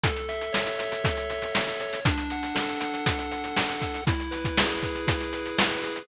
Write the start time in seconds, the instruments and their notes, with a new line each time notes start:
0.03 lead 1 (square) A4, kick, closed hi-hat
0.16 closed hi-hat
0.29 lead 1 (square) E5, closed hi-hat
0.41 closed hi-hat
0.53 lead 1 (square) C#5, snare
0.66 closed hi-hat
0.78 lead 1 (square) E5, closed hi-hat
0.92 closed hi-hat
1.04 lead 1 (square) A4, kick, closed hi-hat
1.17 closed hi-hat
1.30 lead 1 (square) E5, closed hi-hat
1.42 closed hi-hat
1.53 lead 1 (square) E5, snare
1.67 closed hi-hat
1.80 lead 1 (square) C#5, closed hi-hat
1.93 closed hi-hat
2.05 lead 1 (square) D4, kick, closed hi-hat
2.18 closed hi-hat
2.30 lead 1 (square) F#5, closed hi-hat
2.43 closed hi-hat
2.55 lead 1 (square) A4, snare
2.69 closed hi-hat
2.80 lead 1 (square) F#5, closed hi-hat
2.94 closed hi-hat
3.06 lead 1 (square) D4, kick, closed hi-hat
3.19 closed hi-hat
3.32 lead 1 (square) F#5, closed hi-hat
3.44 closed hi-hat
3.57 lead 1 (square) F#5, snare
3.69 closed hi-hat
3.80 lead 1 (square) A4, kick, closed hi-hat
3.94 closed hi-hat
4.07 lead 1 (square) E4, kick, closed hi-hat
4.20 closed hi-hat
4.31 lead 1 (square) B4, closed hi-hat
4.45 kick, closed hi-hat
4.57 lead 1 (square) G#4, snare
4.70 closed hi-hat
4.83 lead 1 (square) B4, kick, closed hi-hat
4.95 closed hi-hat
5.07 lead 1 (square) E4, kick, closed hi-hat
5.20 closed hi-hat
5.33 lead 1 (square) B4, closed hi-hat
5.46 closed hi-hat
5.58 lead 1 (square) B4, snare
5.71 closed hi-hat
5.83 lead 1 (square) G#4, closed hi-hat
5.96 closed hi-hat